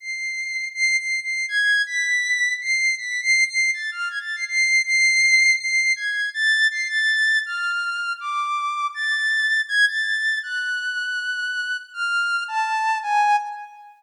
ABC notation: X:1
M:4/4
L:1/16
Q:1/4=161
K:none
V:1 name="Ocarina"
c''8 (3c''4 c''4 c''4 | _a'4 b'8 c''4 | (3b'4 c''4 c''4 a'2 f'2 _a' =a'2 c'' | c''4 c''8 c''4 |
_a'4 =a'4 c''2 a'6 | f'8 d'8 | a'8 _a'2 =a'6 | _g'16 |
f'6 a6 _a4 |]